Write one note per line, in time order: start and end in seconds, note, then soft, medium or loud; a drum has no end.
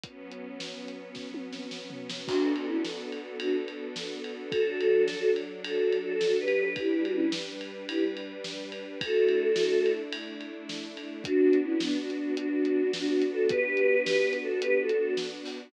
0.04 2.26 F#3 medium
0.04 2.26 B3 medium
0.04 2.26 C#4 medium
0.04 kick medium
0.04 closed hi-hat medium
0.32 closed hi-hat medium
0.60 snare loud
0.88 closed hi-hat medium
1.15 kick medium
1.15 snare medium
1.34 high tom medium
1.53 snare medium
1.71 snare medium
1.90 floor tom medium
2.10 snare loud
2.27 4.50 B3 medium
2.27 2.52 D4 loud
2.27 4.50 D4 medium
2.27 2.52 F#4 loud
2.27 4.50 F#4 medium
2.27 4.50 A4 medium
2.27 kick loud
2.27 crash loud
2.56 2.66 D4 medium
2.56 2.66 F#4 loud
2.56 ride medium
2.67 2.82 C#4 medium
2.67 2.82 E4 medium
2.85 snare loud
3.12 ride medium
3.39 3.56 D4 medium
3.39 3.56 F#4 medium
3.39 ride loud
3.68 ride medium
3.96 snare loud
4.24 ride medium
4.51 6.74 F#3 medium
4.51 6.74 D4 medium
4.51 5.30 F#4 loud
4.51 5.30 A4 loud
4.51 6.74 A4 medium
4.51 kick loud
4.51 ride loud
4.81 ride medium
5.08 snare loud
5.36 ride medium
5.64 5.98 F#4 medium
5.64 5.98 A4 medium
5.64 ride loud
5.92 ride medium
6.03 6.36 F#4 loud
6.03 6.36 A4 loud
6.21 snare loud
6.40 6.73 G4 medium
6.40 6.73 B4 loud
6.48 ride medium
6.76 8.98 G3 medium
6.76 8.98 D4 medium
6.76 7.03 E4 loud
6.76 7.03 G4 loud
6.76 8.98 B4 medium
6.76 kick loud
6.76 ride medium
7.04 7.13 D4 medium
7.04 7.13 F#4 loud
7.04 ride medium
7.14 7.29 C#4 loud
7.14 7.29 E4 loud
7.32 snare loud
7.61 ride medium
7.88 8.04 E4 medium
7.88 8.04 G4 loud
7.88 ride loud
8.17 ride medium
8.44 snare loud
8.72 ride medium
9.01 11.23 A3 medium
9.01 11.23 D4 medium
9.01 11.23 E4 medium
9.01 9.92 F#4 loud
9.01 9.92 A4 loud
9.01 kick loud
9.01 ride loud
9.29 ride medium
9.56 snare loud
9.86 ride medium
10.13 ride loud
10.41 ride medium
10.69 snare loud
10.97 ride medium
11.24 15.69 B3 medium
11.24 11.58 D4 loud
11.24 15.69 D4 medium
11.24 11.58 F#4 loud
11.24 15.69 F#4 medium
11.24 kick loud
11.24 closed hi-hat loud
11.53 closed hi-hat medium
11.63 11.79 C#4 medium
11.63 11.79 E4 loud
11.80 11.97 B3 medium
11.80 11.97 D4 loud
11.80 snare loud
12.01 12.34 D4 medium
12.01 12.34 F#4 medium
12.10 closed hi-hat medium
12.37 13.24 D4 loud
12.37 13.24 F#4 loud
12.37 closed hi-hat loud
12.65 closed hi-hat medium
12.93 snare loud
13.22 closed hi-hat medium
13.31 13.47 F#4 loud
13.31 13.47 A4 loud
13.49 14.01 G4 loud
13.49 14.01 B4 loud
13.49 kick loud
13.49 closed hi-hat loud
13.77 closed hi-hat medium
14.05 14.37 G4 medium
14.05 14.37 B4 loud
14.05 snare loud
14.33 closed hi-hat medium
14.43 14.60 F#4 medium
14.43 14.60 A4 loud
14.61 14.77 G4 loud
14.61 14.77 B4 loud
14.61 closed hi-hat loud
14.81 15.13 F#4 medium
14.81 15.13 A4 loud
14.89 closed hi-hat medium
15.17 snare loud
15.45 open hi-hat medium